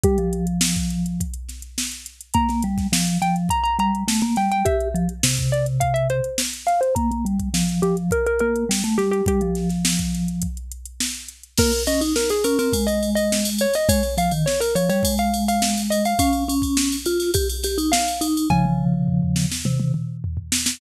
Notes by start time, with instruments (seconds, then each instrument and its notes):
0.03 vibraphone G3, xylophone G4, kick, closed hi-hat
0.18 vibraphone F3, closed hi-hat
0.33 closed hi-hat
0.47 closed hi-hat
0.61 snare
0.76 kick, closed hi-hat
0.90 closed hi-hat
1.06 closed hi-hat
1.20 kick, closed hi-hat
1.34 closed hi-hat
1.49 snare, closed hi-hat
1.62 closed hi-hat
1.78 snare
1.92 closed hi-hat
2.06 closed hi-hat
2.21 closed hi-hat
2.34 vibraphone A#3, xylophone A#5, kick, closed hi-hat
2.49 vibraphone A#3, snare, closed hi-hat
2.62 vibraphone G3, closed hi-hat
2.78 kick, snare, closed hi-hat
2.92 vibraphone F3, snare
3.07 closed hi-hat
3.22 vibraphone F3, xylophone G5, closed hi-hat
3.36 closed hi-hat
3.49 xylophone A#5, kick, closed hi-hat
3.64 xylophone A#5, closed hi-hat
3.79 vibraphone G3, xylophone A#5, closed hi-hat
3.95 closed hi-hat
4.08 vibraphone A3, snare
4.21 vibraphone A#3, closed hi-hat
4.36 vibraphone G3, xylophone G5, snare, closed hi-hat
4.52 xylophone G5, closed hi-hat
4.65 vibraphone G4, xylophone E5, kick, closed hi-hat
4.81 closed hi-hat
4.94 vibraphone F3, closed hi-hat
5.09 closed hi-hat
5.23 vibraphone C3, snare
5.37 kick, closed hi-hat
5.52 xylophone D5, closed hi-hat
5.66 closed hi-hat
5.80 xylophone F5, kick, closed hi-hat
5.94 xylophone E5, closed hi-hat
6.10 xylophone C5, closed hi-hat
6.24 closed hi-hat
6.38 snare
6.53 closed hi-hat
6.66 xylophone F5, snare, closed hi-hat
6.81 xylophone C5, closed hi-hat
6.95 vibraphone A#3, xylophone A#5, kick, closed hi-hat
7.11 vibraphone A#3, closed hi-hat
7.25 vibraphone G3, closed hi-hat
7.39 kick, closed hi-hat
7.54 vibraphone F3, snare
7.69 closed hi-hat
7.82 vibraphone F3, xylophone G4, closed hi-hat
7.97 closed hi-hat
8.11 xylophone A#4, kick, closed hi-hat
8.26 xylophone A#4, closed hi-hat
8.39 vibraphone A#3, xylophone A#4, closed hi-hat
8.56 closed hi-hat
8.69 vibraphone G3, snare
8.84 vibraphone A3, snare, closed hi-hat
8.98 vibraphone G3, xylophone G4, snare, closed hi-hat
9.11 xylophone G4, closed hi-hat
9.26 vibraphone G3, xylophone G4, kick, closed hi-hat
9.41 vibraphone F3, closed hi-hat
9.55 snare, closed hi-hat
9.69 snare, closed hi-hat
9.85 snare
9.99 kick, closed hi-hat
10.14 snare, closed hi-hat
10.28 closed hi-hat
10.42 kick, closed hi-hat
10.57 closed hi-hat
10.72 closed hi-hat
10.85 closed hi-hat
11.00 snare
11.15 closed hi-hat
11.28 closed hi-hat
11.43 closed hi-hat
11.57 vibraphone A#3, xylophone A#4, kick, crash
11.72 ride
11.87 vibraphone C#4, xylophone D#5, ride
12.01 vibraphone D#4, ride
12.16 xylophone A#4, snare
12.29 xylophone G#4, ride
12.44 vibraphone C#4, xylophone A#4, ride
12.59 vibraphone C4, xylophone A#4, ride
12.73 vibraphone G#3, kick, ride
12.87 xylophone D#5, ride
13.03 ride
13.15 xylophone D#5, ride
13.32 snare
13.45 snare, ride
13.59 xylophone C#5, ride
13.73 xylophone D#5, snare, ride
13.89 vibraphone G#3, xylophone C#5, kick, ride
14.03 snare, ride
14.17 vibraphone F3, xylophone F5, ride
14.31 vibraphone D#3, ride
14.46 xylophone C#5, snare
14.60 xylophone A#4, snare, ride
14.75 vibraphone F3, xylophone C#5, ride
14.89 vibraphone G3, xylophone C#5, ride
15.03 vibraphone G#3, kick, ride
15.18 xylophone F5, ride
15.34 ride
15.48 xylophone F5, ride
15.62 snare
15.77 ride
15.90 xylophone D#5, ride
16.05 xylophone F5, ride
16.19 vibraphone C#4, xylophone F5, kick, ride
16.33 ride
16.48 vibraphone C#4, ride
16.62 kick, ride
16.77 snare
16.92 ride
17.06 vibraphone F4, ride
17.20 snare, ride
17.34 vibraphone G4, kick, ride
17.50 ride
17.63 vibraphone G4, snare, ride
17.78 vibraphone D#4, ride
17.92 xylophone F5, snare
18.08 ride
18.21 vibraphone D#4, ride
18.37 ride
18.50 vibraphone C#3 F3, xylophone G#5, kick, high tom
18.65 high tom
18.79 mid tom
18.94 mid tom
19.08 floor tom
19.22 floor tom
19.36 snare
19.52 snare
19.65 vibraphone C3, high tom
19.80 high tom
19.94 mid tom
20.24 floor tom
20.37 floor tom
20.52 snare
20.66 snare